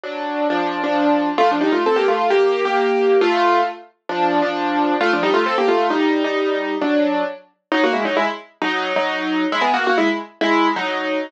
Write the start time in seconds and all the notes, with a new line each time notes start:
0.03 F#3 D4
0.50 F3 D4
0.84 F3 D4
1.38 A3 F4
1.51 F3 D4
1.61 G3 D#4
1.72 A3 F4
1.86 C4 A4
1.96 A#3 G4
2.08 A3 F4
2.30 A#3 G4
2.65 A#3 G4
3.21 A3 F4
4.09 F3 D4
4.42 F3 D4
5.01 A3 F4
5.13 F3 D4
5.23 G3 D#4
5.34 A3 F4
5.46 C4 A4
5.58 A#3 G4
5.68 A3 F4
5.90 G3 D#4
6.24 G3 D#4
6.81 F#3 D4
7.72 F#3 D#4
7.84 A#3 F#4
7.93 G#3 E4
8.05 F#3 D#4
8.17 G#3 E4
8.62 F#3 D#4
8.96 F#3 D#4
9.52 G#3 E4
9.61 B3 G#4
9.74 A#3 F#4
9.87 A#3 F#4
9.98 G#3 E4
10.41 G#3 E4
10.76 F#3 D#4